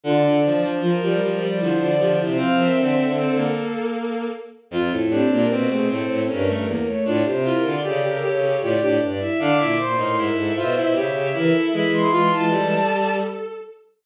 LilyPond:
<<
  \new Staff \with { instrumentName = "Violin" } { \time 3/4 \key f \major \tempo 4 = 77 d''16 d''8 r16 bes'16 bes'16 bes'16 d''16 c''16 d''8 c''16 | f''16 e''16 e''8 a'4 r4 | \key d \minor r16 a'16 g'16 bes'16 b'16 gis'16 a'8 bes'16 bes'16 bes'16 cis''16 | r16 c''16 bes'16 d''16 d''16 bes'16 cis''8 d''16 d''16 d''16 e''16 |
d'''16 d'''16 c'''16 c'''16 e''4 e''16 e''16 e''8 | b''16 c'''16 c'''16 a''4~ a''16 r4 | }
  \new Staff \with { instrumentName = "Violin" } { \time 3/4 \key f \major f'16 d'16 d'8 f'16 g'16 g'16 r16 e'16 f'16 g'16 e'16 | c''16 bes'16 a'2 r8 | \key d \minor f'16 e'16 c'16 bes8 a16 c'8 cis'8 bes16 a16 | f'16 g'16 e'16 f'16 a'4 f'16 d'16 d'16 e'16 |
f''16 e''16 c''16 bes'8 a'16 c''8 cis''8 bes'16 a'16 | gis'8 f'16 e'16 a'4. r8 | }
  \new Staff \with { instrumentName = "Violin" } { \time 3/4 \key f \major d8 f16 f16 f16 f16 f16 g16 f8 f8 | c'4 c'16 bes4~ bes16 r8 | \key d \minor f'16 r16 d'8 c'16 c'16 c'8 cis'16 a16 r8 | d'16 r16 f'8 g'16 g'16 g'8 g'16 g'16 r8 |
d'16 e'16 r16 dis'16 e'8 f'16 e'16 g'8 e'8 | e'8 f'8 g4 r4 | }
  \new Staff \with { instrumentName = "Violin" } { \clef bass \time 3/4 \key f \major d8 f8. g8 f16 d8. c16 | f8 d4 r4. | \key d \minor f,16 a,8 bes,16 b,8 a,16 a,16 g,8 e,16 r16 | a,16 c8 d16 cis8 cis16 cis16 a,8 g,16 r16 |
d16 bes,8 a,16 gis,8 b,16 b,16 cis8 e16 r16 | <e gis>4. r4. | }
>>